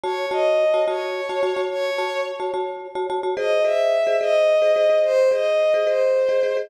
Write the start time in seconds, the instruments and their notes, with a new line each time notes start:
0.03 marimba F#4 C#5 A5, violin C#5
0.31 marimba F#4 C#5 A5, violin D#5
0.74 marimba F#4 C#5 A5
0.88 marimba F#4 C#5 A5, violin C#5
1.29 marimba F#4 C#5 A5
1.43 marimba F#4 C#5 A5
1.56 marimba F#4 C#5 A5
1.71 violin C#5
1.98 marimba F#4 C#5 A5
2.40 marimba F#4 C#5 A5
2.54 marimba F#4 C#5 A5
2.95 marimba F#4 C#5 A5
3.10 marimba F#4 C#5 A5
3.23 marimba F#4 C#5 A5
3.36 marimba G#4 C5 D#5, violin D#5
3.64 marimba G#4 C5 D#5, violin E5
4.07 marimba G#4 C5 D#5
4.21 marimba G#4 C5 D#5, violin D#5
4.62 marimba G#4 C5 D#5
4.76 marimba G#4 C5 D#5
4.89 marimba G#4 C5 D#5
5.04 violin C5
5.31 marimba G#4 C5 D#5, violin D#5
5.74 marimba G#4 C5 D#5
5.87 marimba G#4 C5 D#5, violin C5
6.29 marimba G#4 C5 D#5
6.43 marimba G#4 C5 D#5
6.57 marimba G#4 C5 D#5